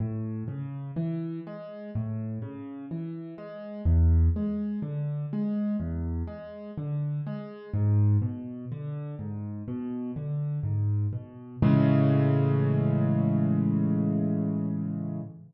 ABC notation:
X:1
M:4/4
L:1/8
Q:1/4=62
K:A
V:1 name="Acoustic Grand Piano" clef=bass
A,, C, E, G, A,, C, E, G, | E,, G, D, G, E,, G, D, G, | G,, B,, D, G,, B,, D, G,, B,, | [A,,C,E,G,]8 |]